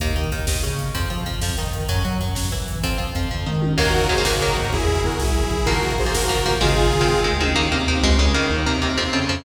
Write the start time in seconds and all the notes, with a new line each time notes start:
0.00 D#2 D#3 A#3, kick, closed hi-hat
0.07 kick
0.16 D#3 D#4, kick, closed hi-hat
0.24 kick
0.32 D#2 D#3, kick, closed hi-hat
0.40 kick
0.47 D#2 D#3, kick, snare
0.55 kick
0.63 C#3 C#4, kick, closed hi-hat
0.71 kick
0.79 kick, closed hi-hat
0.94 F2 F3 C4, kick, closed hi-hat
1.02 kick
1.10 F3 F4, kick, closed hi-hat
1.18 kick
1.26 F2 F3, kick, closed hi-hat
1.34 kick
1.41 F2 F3, kick, snare
1.50 kick
1.57 D#3 D#4, kick, closed hi-hat
1.66 kick
1.73 kick, closed hi-hat
1.81 kick
1.89 F#2 F#3 C#4, kick, closed hi-hat
1.97 kick
2.05 F#3 F#4, kick, closed hi-hat
2.12 kick
2.20 F#2 F#3, kick, closed hi-hat
2.28 kick
2.35 F#2 F#3, kick, snare
2.44 kick
2.52 E3 E4, kick, closed hi-hat
2.60 kick
2.68 kick, closed hi-hat
2.75 kick
2.83 F2 F3 C4, kick, closed hi-hat
2.91 kick
2.98 F3 F4, kick, closed hi-hat
3.07 kick
3.15 F2 F3, kick, closed hi-hat
3.23 kick
3.31 F2 F3, kick, floor tom
3.46 D#3 D#4, mid tom
3.62 high tom
3.78 D#2 D#3 F#3 A#3 F#4 A#4, kick, crash
3.86 kick
3.94 kick, floor tom
4.02 kick
4.09 D#2 D#3 F#3 A#3 G#4 C5, kick, floor tom
4.18 D#3 F#3 A#3, kick
4.25 C#3 D#3 F#3 A#3 F#4 A#4, kick, snare
4.33 kick
4.41 D#3 F#3 A#3, kick, floor tom
4.49 kick
4.56 G#2, kick, floor tom
4.65 kick
4.73 E2 E4 G#4, kick, floor tom
4.80 kick
4.88 kick, floor tom
4.96 kick
5.04 E2 F#4 A#4, kick, floor tom
5.12 kick
5.19 C2 E4 G#4, kick, snare
5.27 kick
5.35 kick, floor tom
5.43 B1, kick
5.51 kick, floor tom
5.59 kick
5.65 A#1 F3 A#3 F#4 A#4, kick, floor tom
5.75 kick
5.83 kick, floor tom
5.91 kick
5.98 A#1 G#4 C5, kick, floor tom
6.06 F3 A#3, kick
6.14 G#2 F#4 A#4, kick, snare
6.22 kick
6.29 F3 A#3, kick, floor tom
6.38 kick
6.46 D#2 F3 A#3, kick, floor tom
6.53 kick
6.61 G#1 D#3 G#3 C4 F4 G#4, kick, floor tom
6.69 kick
6.77 kick, floor tom
6.85 kick
6.93 G#1, kick, floor tom
7.01 D#3 G#3 C4, kick
7.08 C#2, kick, floor tom
7.24 D#3 G#3 C4, mid tom
7.32 D2
7.40 D#3 G#3 C4, high tom
7.54 D#2 D#3 A#3 D#4
7.71 D#2 C3 D#3 A#3 C4
7.88 D#2 C3 D#3 A#3 C4
8.03 C#2 C#3 G#3
8.18 C#2 C#3 G#3 C#4
8.34 C#2 D#3 A#3
8.50 D#2 D#3 D#4
8.66 D#2 C3 D#3 A#3 C4
8.82 D#2 C3 D#3 A#3 C4
8.98 F2 F3 C4
9.13 F2 C#3 F3 C4 C#4
9.29 F2 F3 C4